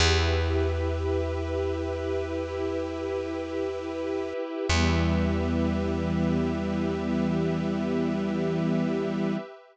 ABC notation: X:1
M:4/4
L:1/8
Q:1/4=51
K:Em
V:1 name="String Ensemble 1"
[EGB]8 | [E,G,B,]8 |]
V:2 name="Pad 5 (bowed)"
[GBe]4 [EGe]4 | [GBe]8 |]
V:3 name="Electric Bass (finger)" clef=bass
E,,8 | E,,8 |]